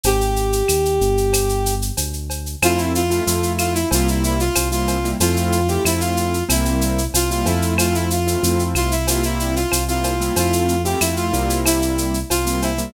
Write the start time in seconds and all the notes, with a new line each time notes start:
0.03 G#1 G4, cowbell, shaker
0.21 shaker
0.36 shaker
0.53 shaker
0.68 D#2, claves, shaker
0.85 shaker
1.01 G1, shaker
1.17 shaker
1.33 cowbell, claves, shaker
1.49 shaker
1.66 shaker
1.82 shaker
1.97 D2, cowbell, shaker
2.13 shaker
2.30 cowbell, shaker
2.46 shaker
2.62 F2 A3 C4 E4 F4, cowbell, claves, shaker
2.77 E4, shaker
2.95 F4, shaker
3.10 A3 C4 E4 F4, shaker
3.27 F2 A3 C4 E4 F4, shaker
3.43 shaker
3.58 F4, claves, shaker
3.74 E4, shaker
3.91 C2 G3 A#3 C4 E4 F4, cowbell, shaker
4.08 E4, shaker
4.24 E4, shaker
4.40 F4, shaker
4.55 C2, cowbell, claves, shaker
4.71 G3 A#3 C4 E4 F4, shaker
4.87 cowbell, shaker
5.04 G3 A#3 C4 E4, shaker
5.20 F2 A3 C4 E4 F4, cowbell, shaker
5.36 shaker
5.52 shaker
5.68 A3 C4 E4 F4 G4, shaker
5.84 F2 A3 C4 E4 F4, claves, shaker
6.00 F4, shaker
6.17 shaker
6.34 shaker
6.49 C2 G3 A#3 C4 E4, cowbell, claves, shaker
6.65 shaker
6.81 shaker
6.98 shaker
7.14 C2 F4, cowbell, shaker
7.30 G3 A#3 C4 E4 F4, shaker
7.46 F2 A3 C4 E4 F4, cowbell, shaker
7.62 shaker
7.78 F4, cowbell, claves, shaker
7.94 E4, shaker
8.10 F4, shaker
8.27 A3 C4 E4 F4, shaker
8.43 F2 A3 C4 E4 F4, shaker
8.59 shaker
8.75 C2 F4, claves, shaker
8.91 E4, shaker
9.07 G3 A#3 C4 E4 F4, cowbell, shaker
9.23 E4, shaker
9.39 E4, shaker
9.55 F4, shaker
9.72 C2, cowbell, claves, shaker
9.88 G3 A#3 C4 E4 F4, shaker
10.04 cowbell, shaker
10.20 G3 A#3 C4 E4, shaker
10.36 F2 A3 C4 E4 F4, cowbell, shaker
10.53 shaker
10.68 shaker
10.84 A3 C4 E4 F4 G4, shaker
11.00 F2 A3 C4 E4 F4, claves, shaker
11.16 F4, shaker
11.33 C2 G3 A#3 C4 E4, shaker
11.50 shaker
11.65 E4, cowbell, claves, shaker
11.82 shaker
11.98 shaker
12.14 shaker
12.30 C2 F4, cowbell, shaker
12.45 G3 A#3 C4 E4 F4, shaker
12.62 E4, cowbell, shaker
12.78 G3 A#3 C4 E4, shaker